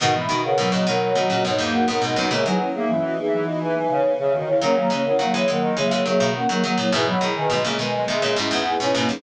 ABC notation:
X:1
M:4/4
L:1/16
Q:1/4=104
K:B
V:1 name="Ocarina"
[Af] [db]2 [Af]2 [Fd] [Af]2 [Fd] [Fd] [Fd]2 [Af] [Af] [Af] [DB] | [Ge] [Bg]2 [Ge]2 [Fd] [Ge]2 [Fd] [Bg] [Bg]2 [Bg] [Ge] [Fd] [Ec] | [Af] [ca]2 [Af]2 [Ge] [Af]2 [Ge] [Ge] [Ge]2 [Af] [Af] [Af] [Ec] | [Bg] [db]2 [Bg]2 [Ge] [Bg]2 [Ge] [Ge] [Ge]2 [Bg] [Bg] [Bg] [DB] |]
V:2 name="Ocarina"
[DF] [G,B,] [DF] [GB] [G,B,]2 [G,B,]2 [G,B,]2 [B,D]2 [DF] [B,D] [B,D] [DF] | [Ac] [EG] [CE] [B,D] [CE]2 [B,D]8 z2 | [A,C] [F,A,] [A,C] [CE] [F,A,]2 [F,A,]2 [F,A,]2 [F,A,]2 [A,C] [F,A,] [F,A,] [F,A,] | [EG] [G,B,] [EG] [GB] [G,B,]2 [G,B,]2 [G,B,]2 [CE]2 [EG] [CE] [CE] [EG] |]
V:3 name="Choir Aahs"
D, E, z C, F,2 F, F,4 A,2 B, G, B, | G, F, z A, E,2 E, E,4 C,2 C, D, C, | C,3 C,3 D,2 C,4 z4 | E, F, z D, G,2 G, G,4 B,2 C A, C |]
V:4 name="Pizzicato Strings" clef=bass
[G,,B,,]2 [B,,D,]2 [G,,B,,] [A,,C,] [B,,D,]2 [B,,D,] [A,,C,] [G,,B,,] [E,,G,,]2 [G,,B,,] [G,,B,,] [D,,F,,] | [A,,C,] [D,F,]13 z2 | [D,F,]2 [E,G,]2 [D,F,] [E,G,] [E,G,]2 [E,G,] [E,G,] [D,F,] [B,,D,]2 [D,F,] [D,F,] [A,,C,] | [G,,B,,]2 [B,,D,]2 [G,,B,,] [A,,C,] [B,,D,]2 [B,,D,] [A,,C,] [G,,B,,] [E,,G,,]2 [G,,B,,] [G,,B,,] [D,,F,,] |]